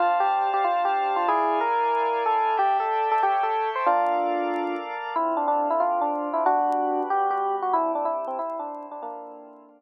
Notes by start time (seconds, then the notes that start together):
0.00 D4 F4 C5 F5 A5
0.20 G4
0.54 G4
0.64 F4
0.85 G4
1.16 F4
1.28 E4 G#4 D5 F5 G#5
1.61 A#4
2.26 A4
2.57 G4 A4 D5 E5 G5
2.80 A4
3.11 A4
3.22 G4 A4 C#5 E5 G5
3.43 A4
3.75 C5
3.86 A#3 D4 F4 A4 D5 F5
5.16 D3 C4 E4 F4
5.37 D4
5.48 D4
5.70 E4
5.80 D3 C4 D4 F4
6.01 D4
6.33 E4
6.45 G3 B3 D4 F#4
7.10 G3 B3 F#4 G4
7.31 G4
7.62 F#4
7.73 C3 G3 D4 E4
7.95 D4
8.05 E4
8.28 C4
8.39 C3 G3 C4 E4
8.59 D4
8.91 D4
9.02 D3 A#3 C4 D4 E4 F4
9.69 D3 C4 D4 F4